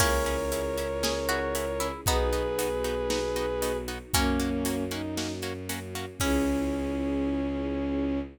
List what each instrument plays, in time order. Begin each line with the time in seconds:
0.00 violin C#2 A#4 C#5, harpsichord A#3 C#4, orchestral harp C#4 E4 G#4, string ensemble 1 C#4 E4 G#4, kick, crash
0.26 orchestral harp C#4 E4 G#4, closed hi-hat
0.52 orchestral harp C#4 E4 G#4, closed hi-hat
0.77 orchestral harp C#4 E4 G#4, closed hi-hat
1.03 orchestral harp C#4 E4 G#4, harpsichord G#4, snare
1.29 orchestral harp C#4 E4 G#4, harpsichord F#4, closed hi-hat
1.55 orchestral harp C#4 E4 G#4, closed hi-hat
1.80 orchestral harp C#4 E4 G#4, harpsichord E4, closed hi-hat
2.06 violin B1 G#4 B4, orchestral harp B3 D#4 F#4, string ensemble 1 B3 D#4 F#4, harpsichord B3 D#4, kick, closed hi-hat
2.33 orchestral harp B3 D#4 F#4, closed hi-hat
2.59 orchestral harp B3 D#4 F#4, closed hi-hat
2.84 orchestral harp B3 D#4 F#4, closed hi-hat
3.10 orchestral harp B3 D#4 F#4, snare
3.36 orchestral harp B3 D#4 F#4, closed hi-hat
3.62 orchestral harp B3 D#4 F#4, closed hi-hat
3.88 orchestral harp B3 D#4 F#4, closed hi-hat
4.14 violin F#2 A#3 C#4, orchestral harp A#3 C#4 F#4, harpsichord A#3 C#4, string ensemble 1 A#3 C#4 F#4, kick, closed hi-hat
4.40 orchestral harp A#3 C#4 F#4, closed hi-hat
4.65 orchestral harp A#3 C#4 F#4, closed hi-hat
4.89 orchestral harp A#3 C#4 F#4, violin D#4, closed hi-hat
5.17 orchestral harp A#3 C#4 F#4, snare
5.42 orchestral harp A#3 C#4 F#4, closed hi-hat
5.69 orchestral harp A#3 C#4 F#4, closed hi-hat
5.95 orchestral harp A#3 C#4 F#4, closed hi-hat
6.20 violin C#2 C#4, orchestral harp C#4 E4 G#4, harpsichord C#4, string ensemble 1 C#4 E4 G#4, kick, crash